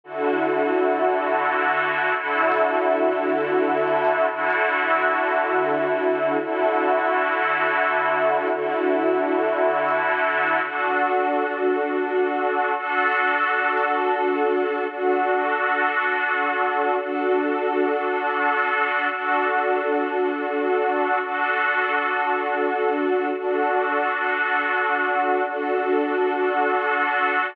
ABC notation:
X:1
M:3/4
L:1/8
Q:1/4=85
K:D
V:1 name="String Ensemble 1"
[D,EFA]6 | [D,EFA]6 | [D,EFA]6 | [D,EFA]6 |
[D,EFA]6 | [DFA]6 | [DFA]6 | [DFA]6 |
[DFA]6 | [DFA]6 | [DFA]6 | [DFA]6 |
[DFA]6 |]